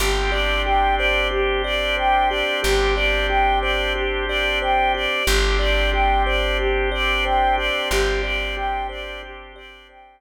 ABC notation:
X:1
M:4/4
L:1/8
Q:1/4=91
K:Gmix
V:1 name="Choir Aahs"
G d g d G d g d | G d g d G d g d | G d g d G d g d | G d g d G d g z |]
V:2 name="Kalimba"
G d G c G d c G | G d G c G d c G | G d G c G d c G | G d G c G d c z |]
V:3 name="Electric Bass (finger)" clef=bass
G,,,8 | G,,,8 | G,,,8 | G,,,8 |]
V:4 name="Drawbar Organ"
[CDG]8- | [CDG]8 | [CDG]8- | [CDG]8 |]